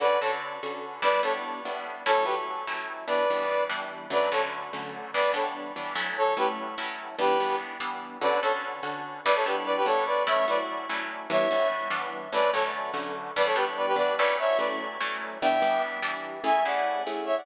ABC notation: X:1
M:5/8
L:1/16
Q:1/4=146
K:D
V:1 name="Brass Section"
[Bd]2 [Ac] z7 | [Bd]2 [Ac] z7 | [Ac]2 [GB] z7 | [Bd]6 z4 |
[Bd]2 [Ac] z7 | [Bd]2 [Ac] z7 | [Ac]2 [GB] z7 | [GB]4 z6 |
[Bd]2 [Ac] z7 | [Bd] [Ac] [GB] z [Bd] [GB] [Ac]2 [Bd]2 | [ce]2 [Bd] z7 | [ce]4 z6 |
[Bd]2 [Ac] z7 | [Bd] [Ac] [GB] z [Bd] [GB] [Bd]2 [Bd]2 | [ce]2 [Bd] z7 | [eg]4 z6 |
[K:A] [eg]2 [df]4 z2 [ce] [df] |]
V:2 name="Acoustic Guitar (steel)"
[D,CFA]2 [D,CFA]4 [D,CFA]4 | [G,B,DE]2 [G,B,DE]4 [G,B,DE]4 | [F,A,CE]2 [F,A,CE]4 [F,A,CE]4 | [E,G,B,D]2 [E,G,B,D]4 [E,G,B,D]4 |
[D,F,A,C]2 [D,F,A,C]4 [D,F,A,C]4 | [E,G,B,D]2 [E,G,B,D]4 [E,G,B,D]2 [F,A,CE]2- | [F,A,CE]2 [F,A,CE]4 [F,A,CE]4 | [E,G,B,D]2 [E,G,B,D]4 [E,G,B,D]4 |
[D,CFA]2 [D,CFA]4 [D,CFA]4 | [G,B,DE]2 [G,B,DE]4 [G,B,DE]4 | [F,A,CE]2 [F,A,CE]4 [F,A,CE]4 | [E,G,B,D]2 [E,G,B,D]4 [E,G,B,D]4 |
[D,F,A,C]2 [D,F,A,C]4 [D,F,A,C]4 | [E,G,B,D]2 [E,G,B,D]4 [E,G,B,D]2 [F,A,CE]2- | [F,A,CE]2 [F,A,CE]4 [F,A,CE]4 | [E,G,B,D]2 [E,G,B,D]4 [E,G,B,D]4 |
[K:A] [A,CEG]2 [A,CEG]4 [A,CEG]4 |]